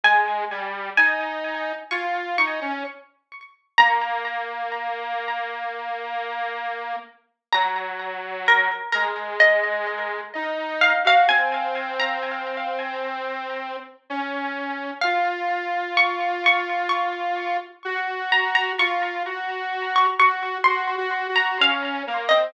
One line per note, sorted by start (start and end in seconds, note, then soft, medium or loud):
0.04 0.45 G#3 medium
0.04 0.88 G#5 medium
0.51 0.90 G3 medium
0.97 1.72 D#4 medium
0.97 1.81 G#5 medium
1.91 2.37 F4 medium
1.91 2.35 C#6 medium
2.38 2.60 D#4 medium
2.38 3.73 C#6 medium
2.61 2.83 C#4 medium
3.78 6.96 A#3 medium
3.78 6.25 A#5 medium
7.53 8.68 F#3 medium
7.53 7.90 A#5 loud
8.48 8.89 A#4 medium
8.92 10.21 G#3 medium
8.92 9.36 A#4 medium
9.40 10.60 D#5 medium
10.35 10.93 D#4 medium
10.81 11.04 F5 medium
11.05 11.27 F#4 medium
11.05 11.29 F5 loud
11.29 13.77 C4 medium
11.29 11.94 G#5 loud
12.00 12.66 A#5 medium
14.10 14.91 C#4 medium
15.01 17.57 F4 medium
15.01 15.43 F5 medium
15.97 16.42 C#6 medium
16.46 16.85 C#6 medium
16.89 18.15 C#6 medium
17.85 18.73 F#4 medium
18.32 18.54 A#5 medium
18.55 18.77 A#5 medium
18.79 19.23 F4 medium
18.79 19.66 C#6 medium
19.26 20.07 F#4 medium
19.96 20.18 C#6 medium
20.19 20.58 F#4 medium
20.19 20.61 C#6 loud
20.64 20.96 F#4 medium
20.64 20.86 C6 loud
20.97 21.27 F#4 medium
21.29 21.58 F#4 medium
21.36 21.58 A#5 medium
21.60 22.03 C#4 medium
21.60 22.01 F5 medium
22.07 22.29 A#3 medium
22.29 22.52 C4 medium
22.29 22.51 D#5 medium